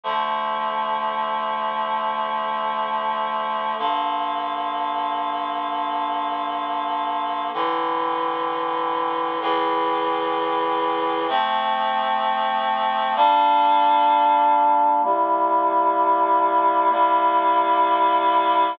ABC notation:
X:1
M:4/4
L:1/8
Q:1/4=64
K:Dm
V:1 name="Clarinet"
[D,F,A,]8 | [G,,D,B,]8 | [A,,D,E,]4 [A,,^C,E,]4 | [K:F] [F,A,C]4 [G,B,D]4 |
[C,G,B,E]4 [C,G,B,E]4 |]